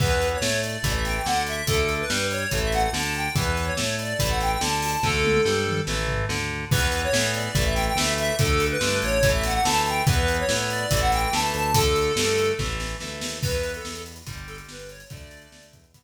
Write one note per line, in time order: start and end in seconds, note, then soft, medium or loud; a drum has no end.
0.00 0.35 E2 medium
0.00 0.38 E3 loud
0.00 0.38 B3 medium
0.00 0.28 B4 medium
0.00 kick loud
0.00 crash medium
0.22 closed hi-hat medium
0.34 0.61 C#5 medium
0.41 0.77 A2 medium
0.41 0.77 A3 medium
0.41 snare loud
0.63 0.93 D5 medium
0.63 closed hi-hat medium
0.83 1.19 A1 medium
0.83 1.22 E3 medium
0.83 1.22 A3 medium
0.83 kick medium
0.83 closed hi-hat loud
0.94 1.04 E5 medium
1.05 1.15 G5 medium
1.05 snare medium
1.05 closed hi-hat medium
1.16 1.26 G5 medium
1.26 1.62 D2 medium
1.26 1.62 D3 medium
1.26 1.43 F#5 medium
1.26 snare loud
1.47 1.66 E5 medium
1.47 closed hi-hat medium
1.67 2.03 D2 medium
1.67 2.05 D3 medium
1.67 2.05 A3 medium
1.67 1.94 A4 medium
1.67 kick loud
1.67 closed hi-hat loud
1.89 closed hi-hat medium
2.00 2.27 B4 medium
2.10 2.46 G2 medium
2.10 2.46 G3 medium
2.10 snare loud
2.31 2.59 C#5 medium
2.31 closed hi-hat medium
2.51 2.87 A1 medium
2.51 2.90 E3 medium
2.51 2.90 A3 medium
2.51 kick medium
2.51 closed hi-hat loud
2.63 2.73 E5 medium
2.72 2.82 F#5 medium
2.72 snare medium
2.72 closed hi-hat medium
2.83 2.93 F#5 medium
2.93 3.28 D2 medium
2.93 3.29 D3 medium
2.93 3.13 A5 medium
2.93 snare loud
3.14 3.34 G5 medium
3.14 closed hi-hat medium
3.35 3.71 E2 loud
3.35 3.73 E3 medium
3.35 3.73 B3 medium
3.35 3.65 B4 medium
3.35 kick loud
3.35 closed hi-hat loud
3.57 closed hi-hat medium
3.65 3.96 C#5 medium
3.77 4.14 A2 medium
3.77 4.13 A3 medium
3.77 snare loud
3.99 4.30 D5 medium
3.99 closed hi-hat medium
4.19 4.55 A1 medium
4.19 4.57 E3 medium
4.19 4.57 A3 medium
4.19 kick medium
4.19 closed hi-hat loud
4.29 4.39 F#5 medium
4.40 4.51 G5 medium
4.40 snare medium
4.40 closed hi-hat medium
4.51 4.61 G5 medium
4.61 4.96 D2 medium
4.61 4.97 D3 medium
4.61 4.80 A5 medium
4.61 snare loud
4.82 5.01 A5 medium
4.82 open hi-hat medium
5.03 5.39 D2 medium
5.03 5.41 D3 loud
5.03 5.41 A3 medium
5.03 5.81 A4 medium
5.03 kick medium
5.03 snare medium
5.24 high tom medium
5.45 5.81 G2 medium
5.45 5.81 G3 medium
5.45 snare medium
5.67 mid tom medium
5.87 6.23 A1 medium
5.87 6.25 E3 loud
5.87 6.25 A3 medium
5.87 snare medium
6.08 floor tom medium
6.29 6.65 D2 medium
6.29 6.65 D3 medium
6.29 snare medium
6.71 7.07 E2 medium
6.71 7.10 E3 medium
6.71 7.10 B3 medium
6.71 7.01 B4 loud
6.71 kick loud
6.71 crash loud
6.92 closed hi-hat medium
7.03 7.31 C#5 medium
7.13 7.48 A2 medium
7.13 7.51 E3 medium
7.13 7.51 B3 medium
7.13 snare loud
7.34 7.65 D5 medium
7.34 closed hi-hat medium
7.55 7.90 A1 loud
7.55 7.93 E3 medium
7.55 7.93 A3 medium
7.55 kick loud
7.55 closed hi-hat loud
7.65 7.74 E5 medium
7.75 7.85 G5 medium
7.75 snare medium
7.75 closed hi-hat medium
7.87 7.97 G5 medium
7.96 8.31 D2 medium
7.96 8.35 E3 medium
7.96 8.35 A3 medium
7.96 8.13 E5 medium
7.96 snare loud
8.18 8.36 E5 loud
8.18 closed hi-hat medium
8.38 8.76 D2 medium
8.38 8.77 D3 loud
8.38 8.77 A3 medium
8.38 8.66 A4 medium
8.38 kick loud
8.38 closed hi-hat loud
8.60 closed hi-hat medium
8.71 8.98 B4 loud
8.81 9.01 G2 medium
8.81 9.19 D3 medium
8.81 9.19 A3 medium
8.81 snare loud
9.02 9.59 A1 medium
9.02 9.30 C#5 loud
9.02 closed hi-hat medium
9.23 9.61 E3 medium
9.23 9.61 A3 medium
9.23 kick loud
9.23 closed hi-hat loud
9.33 9.43 E5 medium
9.43 9.53 F#5 medium
9.43 snare medium
9.43 closed hi-hat loud
9.54 9.64 F#5 medium
9.64 10.01 D2 medium
9.64 10.03 E3 medium
9.64 10.03 A3 medium
9.64 9.82 A5 medium
9.64 snare loud
9.86 10.05 G5 medium
9.86 closed hi-hat medium
10.07 10.42 E2 medium
10.07 10.45 E3 loud
10.07 10.45 B3 loud
10.07 10.37 B4 medium
10.07 kick loud
10.07 closed hi-hat loud
10.28 closed hi-hat medium
10.39 10.69 C#5 medium
10.49 10.85 A2 medium
10.49 10.86 E3 medium
10.49 10.86 B3 medium
10.49 snare loud
10.70 11.00 D5 loud
10.70 closed hi-hat medium
10.91 11.27 A1 medium
10.91 11.29 E3 loud
10.91 11.29 A3 medium
10.91 kick loud
10.91 closed hi-hat loud
11.01 11.11 F#5 medium
11.12 11.22 G5 medium
11.12 snare medium
11.12 closed hi-hat medium
11.23 11.33 G5 medium
11.32 11.52 D2 medium
11.32 11.71 E3 medium
11.32 11.71 A3 medium
11.32 11.52 A5 medium
11.32 snare loud
11.54 12.11 D2 medium
11.54 11.73 A5 medium
11.54 closed hi-hat medium
11.74 12.12 D3 medium
11.74 12.12 A3 medium
11.74 12.52 A4 loud
11.74 kick loud
11.74 closed hi-hat loud
11.96 closed hi-hat medium
12.16 12.52 G2 medium
12.16 12.54 D3 medium
12.16 12.54 A3 medium
12.16 snare loud
12.38 closed hi-hat medium
12.59 12.95 A1 medium
12.59 12.97 E3 loud
12.59 12.97 A3 medium
12.59 kick medium
12.59 snare medium
12.80 snare medium
13.00 13.21 D2 medium
13.00 13.39 E3 medium
13.00 13.39 A3 medium
13.00 snare medium
13.21 13.41 D#2 medium
13.21 snare loud
13.43 13.78 E2 medium
13.43 14.19 E3 medium
13.43 14.19 B3 medium
13.43 13.72 B4 loud
13.43 kick loud
13.43 crash loud
13.53 closed hi-hat medium
13.63 closed hi-hat medium
13.74 14.02 A4 medium
13.74 closed hi-hat medium
13.85 14.22 E2 medium
13.85 snare loud
13.95 closed hi-hat medium
14.06 closed hi-hat loud
14.16 closed hi-hat medium
14.26 14.62 G1 medium
14.26 15.02 D3 medium
14.26 15.02 G3 medium
14.26 kick loud
14.26 closed hi-hat loud
14.38 closed hi-hat medium
14.47 14.57 A4 medium
14.47 closed hi-hat medium
14.58 closed hi-hat medium
14.69 15.05 G1 medium
14.69 14.90 B4 medium
14.69 snare loud
14.79 closed hi-hat medium
14.89 15.09 C#5 medium
14.89 closed hi-hat loud
15.00 closed hi-hat loud
15.10 15.47 D2 medium
15.10 15.86 D3 medium
15.10 15.86 A3 medium
15.10 15.66 D5 loud
15.10 kick loud
15.10 closed hi-hat loud
15.21 closed hi-hat medium
15.31 closed hi-hat loud
15.42 closed hi-hat medium
15.52 15.72 D2 medium
15.52 snare loud
15.63 closed hi-hat medium
15.73 16.03 E2 medium
15.73 kick loud
15.73 closed hi-hat loud
15.84 closed hi-hat medium
15.94 16.03 E3 medium
15.94 16.03 B3 medium
15.94 kick loud
15.94 closed hi-hat loud